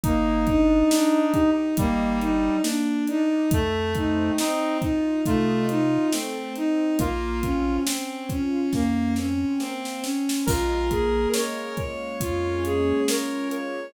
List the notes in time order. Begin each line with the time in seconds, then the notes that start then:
0.03 G1 A#3 D#4, kick, closed hi-hat
0.47 D4 D#4, kick, closed hi-hat
0.90 D4 D#4, snare
1.34 D#4 G4, kick, closed hi-hat
1.77 G1 G3 A#3 D#4, kick, closed hi-hat
2.20 D4 D#4, closed hi-hat
2.63 A#3 D4, snare
3.07 D4 D#4, closed hi-hat
3.50 F2 A3, kick, closed hi-hat
3.95 C4 D#4, kick, closed hi-hat
4.38 C4 D#4, snare
4.80 D#4 F4, kick, closed hi-hat
5.26 C3 A3 D#4 F4, kick, closed hi-hat
5.69 C4 D#4, closed hi-hat
6.12 A3 C4, snare
6.56 C4 D#4, closed hi-hat
6.99 A#1 A#3 F4, kick, closed hi-hat
7.42 C4 C#4, kick, closed hi-hat
7.86 C4 C#4, snare
8.29 C#4 F4, kick, closed hi-hat
8.73 F2 A#3 C#4, kick, snare
9.16 C4 C#4, snare
9.60 A#3 C4, snare
9.85 snare
10.02 C4 C#4, snare
10.29 snare
10.46 A#1 G#3 F4 A#4, kick, crash
10.91 A#3 G#4, kick, closed hi-hat
11.34 C#4 A#4 C#5, snare
11.77 F4 C#5, kick, closed hi-hat
12.20 F2 C#4 F4, kick, closed hi-hat
12.64 A#3 G#4, closed hi-hat
13.08 G#3 A#4 C#5, snare
13.51 A#3 C#5, closed hi-hat